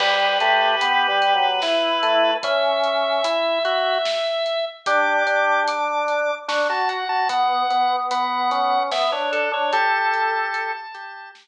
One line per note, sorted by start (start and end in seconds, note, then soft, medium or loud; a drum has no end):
0.00 0.38 G3 loud
0.00 0.33 G4 medium
0.00 2.34 B4 medium
0.00 kick loud
0.00 crash loud
0.40 0.76 A3 medium
0.40 1.47 G4 medium
0.40 closed hi-hat medium
0.81 1.07 B3 medium
0.81 closed hi-hat loud
1.08 1.34 G3 medium
1.22 closed hi-hat medium
1.35 1.61 F#3 medium
1.62 2.31 E4 medium
1.62 snare loud
2.03 2.37 A3 medium
2.03 closed hi-hat medium
2.43 3.22 C#4 medium
2.43 4.65 E5 medium
2.43 kick loud
2.43 closed hi-hat loud
2.84 closed hi-hat medium
3.24 3.59 E4 medium
3.24 closed hi-hat loud
3.65 3.98 F#4 loud
3.65 closed hi-hat medium
4.05 snare loud
4.46 closed hi-hat medium
4.86 5.23 D4 medium
4.86 5.63 G4 medium
4.86 5.60 D6 medium
4.86 kick loud
4.86 closed hi-hat loud
5.27 6.31 D4 medium
5.27 closed hi-hat medium
5.68 6.35 D6 medium
5.68 closed hi-hat loud
6.08 closed hi-hat medium
6.48 6.67 D4 medium
6.48 6.68 C#6 medium
6.48 snare loud
6.69 7.04 F#4 medium
6.69 6.89 A5 medium
6.89 7.08 F#5 medium
6.89 closed hi-hat medium
7.09 7.28 F#4 medium
7.09 7.28 A5 medium
7.29 7.63 B3 medium
7.29 7.96 F#5 medium
7.29 kick loud
7.29 closed hi-hat loud
7.70 8.78 B3 medium
7.70 closed hi-hat medium
8.11 8.50 B3 medium
8.11 8.83 F#5 medium
8.11 closed hi-hat loud
8.51 8.91 C#4 medium
8.51 closed hi-hat medium
8.91 9.10 B3 medium
8.91 9.11 E5 medium
8.91 snare loud
9.12 9.49 D4 medium
9.12 9.31 C#5 medium
9.32 9.52 A4 medium
9.32 closed hi-hat medium
9.52 9.71 D4 medium
9.52 9.73 C#5 medium
9.72 10.73 G4 medium
9.72 10.71 A4 medium
9.72 11.29 A5 medium
9.72 kick loud
9.72 closed hi-hat medium
10.14 closed hi-hat medium
10.54 closed hi-hat loud
10.94 11.31 G4 medium
10.94 closed hi-hat medium
11.35 snare loud